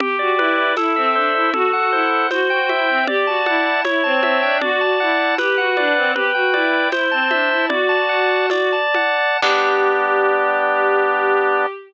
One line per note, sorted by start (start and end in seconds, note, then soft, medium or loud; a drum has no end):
0.00 0.16 G4 medium
0.00 0.73 G4 medium
0.00 low conga loud
0.19 0.35 F#4 medium
0.19 0.57 D5 medium
0.38 0.71 E4 medium
0.38 0.75 B4 medium
0.38 high conga medium
0.58 0.76 D5 medium
0.77 0.95 E4 medium
0.77 1.50 A4 loud
0.77 tambourine medium
0.77 high conga medium
0.96 1.14 C4 medium
0.96 1.34 E5 medium
1.15 1.31 D4 medium
1.15 1.52 C5 medium
1.35 1.51 E4 medium
1.35 1.53 E5 medium
1.54 1.70 F#4 loud
1.54 2.27 A4 loud
1.54 low conga loud
1.73 1.91 F#4 medium
1.73 2.11 F#5 medium
1.92 2.24 E4 medium
1.92 2.29 C5 medium
2.12 2.30 F#5 medium
2.31 2.49 F#4 medium
2.31 3.04 C5 medium
2.31 tambourine medium
2.31 high conga medium
2.50 2.68 F#4 medium
2.50 2.88 G5 medium
2.69 2.88 E4 medium
2.69 3.06 E5 medium
2.69 high conga medium
2.88 3.04 C4 medium
2.88 3.07 G5 medium
3.07 3.25 G4 loud
3.07 3.81 D5 medium
3.07 low conga loud
3.27 3.43 F#4 medium
3.27 3.65 A5 medium
3.46 3.80 E4 medium
3.46 3.83 F#5 medium
3.46 high conga medium
3.65 3.84 A5 medium
3.84 4.01 E4 medium
3.84 4.57 C#5 loud
3.84 tambourine medium
3.84 high conga medium
4.04 4.20 C4 medium
4.04 4.58 A5 medium
4.23 4.39 C4 medium
4.23 4.60 E5 medium
4.23 high conga medium
4.42 4.61 D4 medium
4.42 4.60 G5 medium
4.61 4.80 F#4 loud
4.61 5.35 D5 loud
4.61 low conga loud
4.81 4.98 F#4 medium
4.81 5.19 A5 medium
5.00 5.35 E4 medium
5.00 5.37 F#5 medium
5.19 5.37 A5 medium
5.38 5.56 G4 medium
5.38 6.12 B4 medium
5.38 tambourine medium
5.38 high conga medium
5.58 5.76 F#4 medium
5.58 5.96 F#5 medium
5.77 5.93 D4 medium
5.77 6.13 D5 medium
5.77 high conga medium
5.96 6.13 C4 medium
5.96 6.14 F#5 medium
6.15 6.31 G4 loud
6.15 6.88 B4 medium
6.15 low conga medium
6.35 6.53 F#4 medium
6.35 6.72 G5 medium
6.54 6.88 E4 medium
6.54 6.90 D5 medium
6.54 high conga medium
6.73 6.91 G5 medium
6.92 7.08 E4 medium
6.92 7.66 C5 loud
6.92 tambourine medium
6.92 high conga medium
7.11 7.29 C4 medium
7.11 7.50 A5 medium
7.31 7.49 D4 medium
7.31 7.67 E5 medium
7.31 high conga medium
7.50 7.69 E4 medium
7.50 7.69 A5 medium
7.69 8.73 F#4 medium
7.69 8.46 D5 loud
7.69 low conga loud
7.89 8.29 A5 medium
8.09 8.49 F#5 medium
8.30 8.50 A5 medium
8.50 9.37 D5 loud
8.50 tambourine medium
8.50 high conga medium
8.72 9.18 A5 medium
8.94 9.40 F#5 medium
8.94 high conga medium
9.18 9.41 A5 medium
9.42 11.66 G3 loud
9.42 11.66 B3 loud
9.42 11.66 D4 medium
9.42 11.66 G4 loud
9.42 kick loud
9.42 crash loud